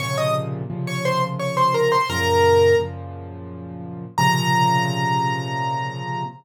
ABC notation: X:1
M:3/4
L:1/16
Q:1/4=86
K:Bbm
V:1 name="Acoustic Grand Piano"
[dd'] [ee'] z3 [dd'] [cc'] z [dd'] [cc'] [Bb] [cc'] | [Bb]4 z8 | b12 |]
V:2 name="Acoustic Grand Piano" clef=bass
[B,,C,D,F,]4 [B,,C,D,F,]8 | [G,,B,,D,F,]4 [G,,B,,D,F,]8 | [B,,C,D,F,]12 |]